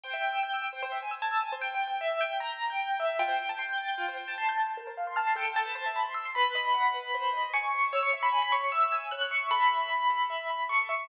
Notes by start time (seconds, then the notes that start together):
0.04 C5 G5
0.13 E5
0.23 G5
0.33 E6
0.43 G6
0.54 E6
0.62 G5
0.73 C5
0.83 C5
0.92 E5
1.03 G#5
1.11 E6
1.22 A5 G#6
1.31 E6
1.41 G#5
1.52 C5
1.62 G5
1.75 G5
1.88 G5
2.01 E5
2.21 G5
2.40 A#5
2.70 G5
3.00 E5
3.19 F4 G5
3.28 C5
3.39 G5
3.49 A5
3.59 C6
3.69 G6
3.78 A6
3.88 G6
3.98 F4
4.08 C5
4.18 G5
4.28 A5
4.38 A5 C6
4.49 G6
4.58 A6
4.67 G6
4.77 A#4
4.87 C5
4.97 F5
5.07 C6
5.16 A5 F6
5.27 C6
5.36 A4 G5
5.56 A5
5.66 B4
5.75 C5
5.86 E5
5.96 B5
6.05 C6
6.14 E6
6.25 C6
6.35 B4 B5
6.55 D#5
6.74 F#5
6.94 B4
7.14 C5
7.33 D#5
7.54 G#5 C#6
7.74 C5
7.93 C#5 E6
8.03 C#6
8.13 E5
8.23 B5
8.32 G#5 B5
8.42 B5
8.52 C#5 C#6
8.72 E5 E6
8.92 G#5
9.11 C#5 F#6
9.21 F#6
9.31 E5 C#6
9.51 A4 B5
9.71 E5
9.90 B5
10.10 A4
10.30 E5
10.50 B5
10.69 A4 C#6
10.89 E5